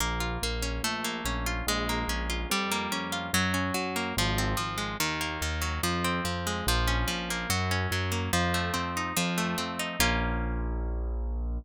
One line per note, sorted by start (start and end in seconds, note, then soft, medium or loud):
0.00 0.38 A#1 loud
0.00 0.43 A#3 loud
0.20 0.80 F4 medium
0.42 0.80 A#1 medium
0.42 0.83 A#3 medium
0.62 0.82 C#4 medium
0.83 1.21 A#1 medium
0.83 1.63 A3 loud
1.04 1.64 A#3 medium
1.25 1.62 A#1 medium
1.25 1.65 C#4 medium
1.46 1.66 F4 medium
1.67 2.04 A#1 loud
1.67 2.47 G#3 loud
1.89 2.48 A#3 medium
2.08 2.45 A#1 medium
2.08 2.49 C#4 medium
2.30 2.49 F4 medium
2.50 2.87 F2 medium
2.50 3.31 G3 loud
2.71 3.31 A#3 medium
2.92 3.29 F2 medium
2.92 3.32 C#4 medium
3.12 3.32 F4 medium
3.33 3.71 F#2 medium
3.33 3.74 F#3 loud
3.54 4.13 C#4 medium
3.74 4.13 F#2 medium
3.74 4.14 F#3 medium
3.96 4.16 A#3 medium
4.17 4.55 G#1 loud
4.17 4.57 F3 loud
4.38 4.98 C4 medium
4.57 4.95 G#1 medium
4.57 4.97 F3 medium
4.78 4.97 G#3 medium
5.00 5.37 D#2 medium
5.00 5.42 D#3 medium
5.21 5.80 A#3 medium
5.42 5.79 D#2 medium
5.42 5.82 D#3 medium
5.61 5.81 F#3 medium
5.83 6.20 F2 loud
5.83 6.24 F3 loud
6.04 6.64 C4 medium
6.24 6.62 F2 medium
6.24 6.64 F3 medium
6.47 6.66 G#3 medium
6.67 7.05 A#1 loud
6.67 7.07 F3 loud
6.88 7.47 C#4 medium
7.08 7.45 A#1 medium
7.08 7.47 F3 medium
7.30 7.50 A#3 medium
7.50 7.87 F#2 loud
7.50 7.91 F#3 loud
7.71 8.30 C#4 medium
7.91 8.29 F#2 medium
7.91 8.32 F#3 medium
8.12 8.31 A#3 medium
8.33 8.71 F2 loud
8.33 9.12 F3 loud
8.54 9.13 A3 medium
8.74 9.13 F2 medium
8.74 9.13 C4 medium
8.97 9.17 D#4 medium
9.17 9.55 F2 loud
9.17 9.96 F3 loud
9.38 9.97 A3 medium
9.58 9.96 F2 medium
9.58 9.97 C4 medium
9.79 9.99 D#4 medium
10.00 11.58 A#1 loud
10.00 11.59 A#3 loud
10.00 11.59 C#4 medium
10.00 11.59 F4 loud